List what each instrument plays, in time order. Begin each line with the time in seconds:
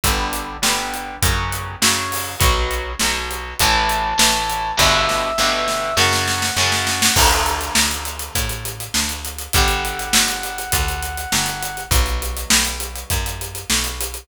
0.04 electric bass (finger) G1, acoustic guitar (steel) D3 G3 B3, kick, closed hi-hat
0.33 closed hi-hat
0.62 electric bass (finger) G1, acoustic guitar (steel) D3 G3 B3, snare
0.94 closed hi-hat
1.22 electric bass (finger) F#2, acoustic guitar (steel) C#3 F#3, kick, closed hi-hat
1.52 closed hi-hat
1.82 electric bass (finger) F#2, acoustic guitar (steel) C#3 F#3, snare
2.12 open hi-hat
2.40 electric bass (finger) B1, acoustic guitar (steel) B2 F#3, kick, closed hi-hat
2.71 closed hi-hat
2.99 electric bass (finger) B1, acoustic guitar (steel) B2 F#3, snare
3.31 closed hi-hat
3.59 electric bass (finger) A1, acoustic guitar (steel) A2 E3, brass section A5, kick, closed hi-hat
3.89 closed hi-hat
4.18 electric bass (finger) A1, acoustic guitar (steel) A2 E3, snare
4.50 closed hi-hat
4.77 electric bass (finger) G1, acoustic guitar (steel) G2 B2 D3, brass section E5, kick, snare
5.09 snare
5.38 electric bass (finger) G1, acoustic guitar (steel) G2 B2 D3, snare
5.68 snare
5.97 acoustic guitar (steel) F#2 C#3, electric bass (finger) F#2, brass section F#5, snare
6.13 snare
6.27 snare
6.42 snare
6.56 electric bass (finger) F#2, acoustic guitar (steel) F#2 C#3, snare
6.72 snare
6.87 snare
7.02 snare
7.16 electric bass (finger) D2, acoustic guitar (steel) D3 A3, kick, crash
7.31 closed hi-hat
7.46 closed hi-hat
7.61 closed hi-hat
7.75 electric bass (finger) D2, snare
7.91 closed hi-hat
8.05 closed hi-hat
8.19 closed hi-hat
8.35 electric bass (finger) A2, kick, closed hi-hat
8.49 closed hi-hat
8.65 closed hi-hat
8.80 closed hi-hat
8.94 electric bass (finger) D2, snare
9.09 closed hi-hat
9.25 closed hi-hat
9.38 closed hi-hat
9.53 electric bass (finger) G1, acoustic guitar (steel) D3 G3, brass section F#5, kick, closed hi-hat
9.68 closed hi-hat
9.85 closed hi-hat
9.99 closed hi-hat
10.13 electric bass (finger) G1, snare
10.28 closed hi-hat
10.43 closed hi-hat
10.58 closed hi-hat
10.72 electric bass (finger) D2, kick, closed hi-hat
10.88 closed hi-hat
11.02 closed hi-hat
11.17 closed hi-hat
11.32 electric bass (finger) G1, snare
11.46 closed hi-hat
11.62 closed hi-hat
11.77 closed hi-hat
11.91 electric bass (finger) B1, acoustic guitar (steel) B2 F#3, kick, closed hi-hat
12.06 closed hi-hat
12.22 closed hi-hat
12.37 closed hi-hat
12.50 electric bass (finger) B1, snare
12.65 closed hi-hat
12.80 closed hi-hat
12.96 closed hi-hat
13.10 electric bass (finger) F#2, kick, closed hi-hat
13.26 closed hi-hat
13.41 closed hi-hat
13.55 closed hi-hat
13.70 electric bass (finger) B1, snare
13.84 closed hi-hat
14.01 closed hi-hat
14.14 closed hi-hat